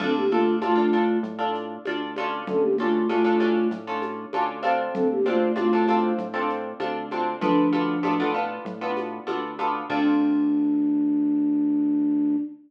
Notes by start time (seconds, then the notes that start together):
0.00 D2 C4 D4 F4 A4, crash, low conga, shaker
0.16 A#3 G4
0.29 A3 D4 F4 A4, shaker
0.62 A2 A3 D4 F4 A4, high conga, shaker
0.76 D4 F4 A4
0.93 D4 F4 A4, shaker
1.23 A2, low conga, shaker
1.39 D4 F4 A4
1.55 shaker
1.85 D2 D4 F4 A4, high conga, shaker
2.16 C#4 D4 F4 A4, high conga, shaker
2.47 D2 C#4 A4, low conga, shaker
2.61 A#3 G4
2.78 A3 C#4 D4 F4 A4, high conga, shaker
3.09 A2 A3 C#4 D4 F4 A4, high conga, shaker
3.24 C#4 D4 F4 A4
3.40 C#4 D4 F4 A4, high conga, shaker
3.70 A2, low conga, shaker
3.87 C#4 D4 F4 A4
4.02 high conga, shaker
4.33 D2 C#4 D4 F4 A4, high conga, shaker
4.63 C4 D4 F4 A4, high conga, shaker
4.93 D2 C4 A4, low conga, shaker
5.11 A#3 G4
5.26 A3 C4 D4 F4 A4, high conga, shaker
5.56 A2 A3 C4 D4 F4 A4, high conga, shaker
5.73 C4 D4 F4 A4
5.88 C4 D4 F4 A4, high conga, shaker
6.18 A2, low conga, shaker
6.34 C4 D4 F4 A4
6.49 shaker
6.80 D2 C4 D4 F4 A4, high conga, shaker
7.11 C4 D4 F4 A4, high conga, shaker
7.40 D2 F3 B3 D4 F4 A4, low conga, shaker
7.73 B3 D4 F4 A4, high conga, shaker
8.03 A2 B3 D4 F4 A4, high conga, shaker
8.20 B3 D4 F4 A4
8.34 B3 D4 F4 A4, shaker
8.65 A2, low conga, shaker
8.81 B3 D4 F4 A4
8.97 high conga, shaker
9.27 D2 B3 D4 F4 A4, high conga, shaker
9.59 B3 D4 F4 A4, high conga, shaker
9.89 D2 C4 D4 F4 A4, kick, crash